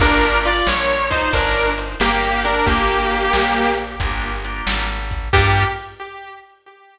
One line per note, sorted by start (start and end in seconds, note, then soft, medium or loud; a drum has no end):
0.00 0.62 G1 medium
0.00 0.53 A#3 medium
0.00 0.53 D4 medium
0.00 0.37 D4 loud
0.00 0.53 F4 medium
0.00 0.53 G4 medium
0.00 0.37 A#4 loud
0.00 kick loud
0.00 crash loud
0.45 0.66 F4 medium
0.45 0.66 D5 loud
0.45 closed hi-hat medium
0.67 1.29 A#1 medium
0.67 1.04 C#5 loud
0.67 snare loud
1.10 1.32 D#4 medium
1.10 1.32 C5 loud
1.10 kick medium
1.10 closed hi-hat medium
1.33 1.96 G1 medium
1.33 1.70 D4 medium
1.33 1.70 A#4 loud
1.33 kick medium
1.33 closed hi-hat loud
1.78 closed hi-hat medium
2.00 2.62 G1 medium
2.00 2.41 A#3 medium
2.00 2.41 G4 loud
2.00 snare medium
2.44 2.65 D4 medium
2.44 2.65 A#4 loud
2.44 closed hi-hat medium
2.66 3.29 G1 medium
2.66 3.71 A#3 loud
2.66 3.71 G4 loud
2.66 kick medium
2.66 closed hi-hat medium
3.11 closed hi-hat medium
3.33 3.96 A#1 medium
3.33 snare loud
3.78 closed hi-hat medium
4.00 4.62 G1 medium
4.00 4.31 A#3 medium
4.00 4.31 D4 medium
4.00 4.31 F4 medium
4.00 4.31 G4 medium
4.00 kick medium
4.00 closed hi-hat loud
4.45 4.85 A#3 medium
4.45 4.85 D4 medium
4.45 4.85 F4 medium
4.45 4.85 G4 medium
4.45 closed hi-hat medium
4.67 5.29 G#1 medium
4.67 snare loud
5.11 kick medium
5.11 closed hi-hat medium
5.33 5.65 G2 loud
5.33 5.65 A#3 loud
5.33 5.65 D4 loud
5.33 5.65 F4 loud
5.33 5.64 G4 loud
5.33 5.65 G4 medium
5.33 kick loud
5.33 crash loud